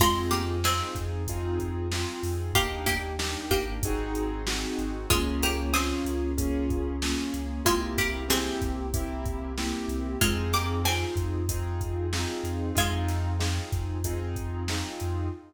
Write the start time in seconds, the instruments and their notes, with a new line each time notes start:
0.00 synth bass 2 F2, pizzicato strings G#3 F4, acoustic grand piano C4 D#4 F4 G#4, kick, crash
0.31 pizzicato strings A#3 G4, snare, closed hi-hat
0.64 acoustic grand piano C4 D#4 F4 G#4, pizzicato strings C4 G#4, snare
0.95 synth bass 2 F2, kick, closed hi-hat
1.28 acoustic grand piano C4 D#4 F4 G#4, kick, closed hi-hat
1.60 kick, closed hi-hat
1.92 acoustic grand piano C4 D#4 F4 G#4, snare
2.23 synth bass 2 F2, open hi-hat
2.53 synth bass 2 D#2, pizzicato strings A#3 G4, acoustic grand piano A#3 D4 D#4 G4, kick, closed hi-hat
2.86 pizzicato strings A#3 G4, kick, snare, closed hi-hat
3.19 acoustic grand piano A#3 D4 D#4 G4, snare
3.51 synth bass 2 G#1, pizzicato strings A#3 G4, kick, closed hi-hat
3.83 acoustic grand piano C4 D#4 F#4 G#4, kick, closed hi-hat
4.15 closed hi-hat
4.47 acoustic grand piano C4 D#4 F#4 G#4, snare
4.78 synth bass 2 G#1, closed hi-hat
5.10 synth bass 2 C#2, pizzicato strings G#3 F4, acoustic grand piano A#3 C#4 F4 G#4, kick, closed hi-hat
5.43 pizzicato strings A#3 G4, snare, closed hi-hat
5.73 acoustic grand piano A#3 C#4 F4 G#4, pizzicato strings C4 G#4, snare
6.05 synth bass 2 C#2, closed hi-hat
6.38 acoustic grand piano A#3 C#4 F4 G#4, kick, closed hi-hat
6.70 kick, closed hi-hat
7.02 acoustic grand piano A#3 C#4 F4 G#4, snare
7.34 synth bass 2 C#2, closed hi-hat
7.65 synth bass 2 C2, pizzicato strings G#3 F4, acoustic grand piano A#3 C4 E4 G4, kick, closed hi-hat
7.98 pizzicato strings A#3 G4, kick, snare, closed hi-hat
8.28 acoustic grand piano A#3 C4 E4 G4, pizzicato strings C4 G#4, snare
8.62 synth bass 2 C2, kick, closed hi-hat
8.94 acoustic grand piano A#3 C4 E4 G4, kick, closed hi-hat
9.26 kick, closed hi-hat
9.58 acoustic grand piano A#3 C4 E4 G4, snare
9.88 synth bass 2 C2, closed hi-hat
10.21 synth bass 2 F2, pizzicato strings G#3 F4, acoustic grand piano C4 D#4 F4 G#4, kick, closed hi-hat
10.53 pizzicato strings A#3 G4, snare, closed hi-hat
10.84 acoustic grand piano C4 D#4 F4 G#4, pizzicato strings C4 G#4, snare
11.16 synth bass 2 F2, kick, closed hi-hat
11.49 acoustic grand piano C4 D#4 F4 G#4, kick, closed hi-hat
11.81 kick, closed hi-hat
12.13 acoustic grand piano C4 D#4 F4 G#4, snare
12.43 synth bass 2 F2, closed hi-hat
12.75 synth bass 2 F2, pizzicato strings G#3 F4, acoustic grand piano C4 D#4 F4 G#4, kick, closed hi-hat
13.08 snare, closed hi-hat
13.39 acoustic grand piano C4 D#4 F4 G#4, snare
13.72 synth bass 2 F2, kick, snare, closed hi-hat
14.04 acoustic grand piano C4 D#4 F4 G#4, kick, closed hi-hat
14.36 kick, closed hi-hat
14.68 acoustic grand piano C4 D#4 F4 G#4, snare
15.00 synth bass 2 F2, closed hi-hat